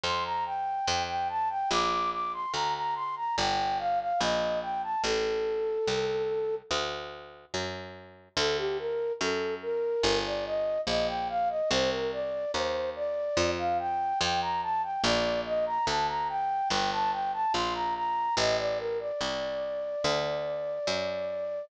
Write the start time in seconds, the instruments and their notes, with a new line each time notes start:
0.03 harpsichord F2, flute C6
0.25 flute A#5
0.45 flute G5
0.87 harpsichord F2
1.08 flute G5
1.29 flute A5
1.50 flute G5
1.70 harpsichord A#1, flute D6
2.12 flute D6
2.33 flute C6
2.53 harpsichord D2, flute A#5
2.74 flute A#5
2.95 flute C6
3.16 flute A#5
3.37 harpsichord G1, flute G5
3.79 flute F5
4.00 flute F5
4.20 harpsichord A#1, flute D#5
4.62 flute G5
4.83 flute A5
5.04 harpsichord A1, flute A4
5.87 harpsichord C2
6.71 harpsichord D2
7.54 harpsichord F#2
8.37 harpsichord D2, flute A4
8.58 flute G4
8.79 flute A#4
9.20 harpsichord F#2, flute A4
9.62 flute A#4
10.03 harpsichord G1
10.25 flute D5
10.46 flute D#5
10.87 harpsichord A#1, flute D#5
11.08 flute G5
11.29 flute F5
11.49 flute D#5
11.70 harpsichord C2, flute C5
11.91 flute A#4
12.12 flute D5
12.54 harpsichord D#2, flute C5
12.96 flute D5
13.37 harpsichord F2
13.58 flute F5
13.79 flute G5
14.20 harpsichord F2, flute G5
14.41 flute A#5
14.62 flute A5
14.83 flute G5
15.03 harpsichord A#1, flute D5
15.45 flute D#5
15.66 flute A#5
15.87 harpsichord D2, flute A5
16.08 flute A#5
16.29 flute G5
16.70 harpsichord G1, flute G5
16.91 flute A5
17.12 flute G5
17.33 flute A5
17.54 harpsichord A#1, flute C6
17.74 flute A#5
17.95 flute A#5
18.37 harpsichord A1, flute D#5
18.58 flute D5
18.79 flute A#4
19.00 flute D5
19.20 harpsichord C2
20.04 harpsichord D2
20.87 harpsichord F#2